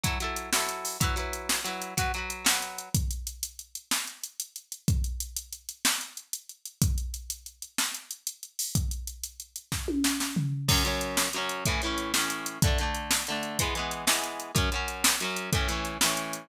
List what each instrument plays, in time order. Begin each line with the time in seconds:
0.03 overdriven guitar F#3 E4 A4, kick, closed hi-hat
0.20 overdriven guitar F#3 E4 A4, closed hi-hat
0.36 closed hi-hat
0.53 overdriven guitar F#3 E4, snare
0.57 overdriven guitar A4
0.69 closed hi-hat
0.85 open hi-hat
1.00 overdriven guitar F#3 E4 B4, kick, closed hi-hat
1.16 overdriven guitar F#3 E4 B4, closed hi-hat
1.33 closed hi-hat
1.49 snare
1.65 overdriven guitar F#3 E4 B4, closed hi-hat
1.82 closed hi-hat
1.97 overdriven guitar F#3 F#4 B4, kick, closed hi-hat
2.14 overdriven guitar F#3 F#4, closed hi-hat
2.18 overdriven guitar B4
2.30 closed hi-hat
2.45 overdriven guitar F#3 F#4 B4, snare
2.62 closed hi-hat
2.78 closed hi-hat
2.94 kick, closed hi-hat
3.11 closed hi-hat
3.27 closed hi-hat
3.43 closed hi-hat
3.59 closed hi-hat
3.75 closed hi-hat
3.91 snare
4.07 closed hi-hat
4.24 closed hi-hat
4.40 closed hi-hat
4.56 closed hi-hat
4.72 closed hi-hat
4.88 kick, closed hi-hat
5.04 closed hi-hat
5.20 closed hi-hat
5.36 closed hi-hat
5.53 closed hi-hat
5.69 closed hi-hat
5.85 snare
6.01 closed hi-hat
6.17 closed hi-hat
6.33 closed hi-hat
6.49 closed hi-hat
6.65 closed hi-hat
6.82 kick, closed hi-hat
6.98 closed hi-hat
7.14 closed hi-hat
7.30 closed hi-hat
7.46 closed hi-hat
7.62 closed hi-hat
7.78 snare
7.94 closed hi-hat
8.11 closed hi-hat
8.27 closed hi-hat
8.43 closed hi-hat
8.59 open hi-hat
8.75 kick, closed hi-hat
8.91 closed hi-hat
9.07 closed hi-hat
9.24 closed hi-hat
9.40 closed hi-hat
9.56 closed hi-hat
9.72 kick, snare
9.88 high tom
10.04 snare
10.20 snare
10.36 floor tom
10.68 overdriven guitar F#2 F#3 C#4, kick, crash
10.84 overdriven guitar F#2 F#3 C#4, closed hi-hat
11.01 closed hi-hat
11.17 snare
11.33 overdriven guitar F#2 F#3, closed hi-hat
11.38 overdriven guitar C#4
11.49 closed hi-hat
11.65 overdriven guitar A2 E3, kick, closed hi-hat
11.70 overdriven guitar C#4
11.82 overdriven guitar A2 E3, closed hi-hat
11.86 overdriven guitar C#4
11.98 closed hi-hat
12.14 overdriven guitar A2 E3 C#4, snare
12.30 closed hi-hat
12.46 closed hi-hat
12.62 overdriven guitar D3 A3, kick, closed hi-hat
12.67 overdriven guitar D4
12.78 overdriven guitar D3 A3, closed hi-hat
12.83 overdriven guitar D4
12.94 closed hi-hat
13.11 snare
13.27 overdriven guitar D3 A3, closed hi-hat
13.32 overdriven guitar D4
13.43 closed hi-hat
13.59 overdriven guitar E3 G#3, kick, closed hi-hat
13.63 overdriven guitar B3
13.75 overdriven guitar E3 G#3 B3, closed hi-hat
13.91 closed hi-hat
14.07 overdriven guitar E3 G#3 B3, snare
14.24 closed hi-hat
14.40 closed hi-hat
14.55 overdriven guitar F#2 F#3 C#4, kick, closed hi-hat
14.72 overdriven guitar F#2 F#3 C#4, closed hi-hat
14.88 closed hi-hat
15.04 snare
15.20 overdriven guitar F#2 F#3 C#4, closed hi-hat
15.36 closed hi-hat
15.53 overdriven guitar A2 E3 C#4, kick, closed hi-hat
15.68 overdriven guitar A2 E3 C#4, closed hi-hat
15.85 closed hi-hat
16.01 overdriven guitar A2 E3, snare
16.06 overdriven guitar C#4
16.17 closed hi-hat
16.33 closed hi-hat